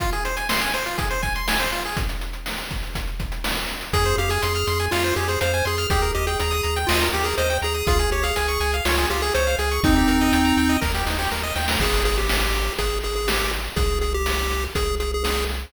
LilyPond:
<<
  \new Staff \with { instrumentName = "Lead 1 (square)" } { \time 4/4 \key f \minor \tempo 4 = 122 r1 | r1 | aes'8 g'16 aes'4~ aes'16 f'8 g'16 aes'16 c''8 aes'8 | aes'8 g'16 aes'4~ aes'16 f'8 g'16 aes'16 c''8 aes'8 |
aes'8 g'16 aes'4~ aes'16 f'8 g'16 aes'16 c''8 aes'8 | <c' ees'>2 r2 | \key aes \major aes'8 aes'16 g'4~ g'16 aes'8 aes'16 aes'16 g'8 r8 | aes'8 aes'16 g'4~ g'16 aes'8 aes'16 aes'16 aes'8 r8 | }
  \new Staff \with { instrumentName = "Lead 1 (square)" } { \time 4/4 \key f \minor f'16 aes'16 c''16 aes''16 c'''16 aes''16 c''16 f'16 aes'16 c''16 aes''16 c'''16 aes''16 c''16 f'16 aes'16 | r1 | aes'16 c''16 f''16 aes''16 c'''16 f'''16 c'''16 aes''16 f''16 c''16 aes'16 c''16 f''16 aes''16 c'''16 f'''16 | g'16 bes'16 ees''16 g''16 bes''16 ees'''16 bes''16 g''16 ees''16 bes'16 g'16 bes'16 ees''16 g''16 bes''16 ees'''16 |
f'16 aes'16 des''16 f''16 aes''16 des'''16 aes''16 f''16 des''16 aes'16 f'16 aes'16 des''16 f''16 aes''16 des'''16 | ees'16 g'16 bes'16 ees''16 g''16 bes''16 g''16 ees''16 bes'16 g'16 ees'16 g'16 bes'16 ees''16 g''16 bes''16 | \key aes \major r1 | r1 | }
  \new Staff \with { instrumentName = "Synth Bass 1" } { \clef bass \time 4/4 \key f \minor r1 | r1 | f,8 f,8 f,8 f,8 f,8 f,8 f,8 f,8 | ees,8 ees,8 ees,8 ees,8 ees,8 ees,8 ees,8 ees,8 |
des,8 des,8 des,8 des,8 des,8 des,8 des,8 des,8 | ees,8 ees,8 ees,8 ees,8 ees,8 ees,8 ees,8 ees,8 | \key aes \major aes,,2 aes,,2 | c,2 c,2 | }
  \new DrumStaff \with { instrumentName = "Drums" } \drummode { \time 4/4 <hh bd>16 hh16 hh16 hh16 sn16 hh16 hh16 hh16 <hh bd>16 hh16 <hh bd>16 hh16 sn16 hh16 hh16 hh16 | <hh bd>16 hh16 hh16 hh16 sn16 hh16 <hh bd>16 hh16 <hh bd>16 hh16 <hh bd>16 hh16 sn16 hh16 hh16 hh16 | <hh bd>16 hh16 hh16 hh16 hh16 hh16 hh16 hh16 sn16 hh16 hh16 hh16 hh16 hh16 hh16 hh16 | <hh bd>16 hh16 hh16 hh16 hh16 hh16 hh16 hh16 sn16 hh16 hh16 hh16 hh16 hh16 hh16 hh16 |
<hh bd>16 hh16 hh16 hh16 hh16 hh16 hh16 hh16 sn16 hh16 hh16 hh16 hh16 hh16 hh16 hh16 | <hh bd>16 hh16 hh16 hh16 hh16 hh16 hh16 hh16 <bd sn>16 sn16 sn16 sn16 sn8 sn16 sn16 | <cymc bd>8 hh8 sn8 hh8 <hh bd>8 hh8 sn8 hh8 | <hh bd>8 hh8 sn8 hh8 <hh bd>8 hh8 sn8 hh8 | }
>>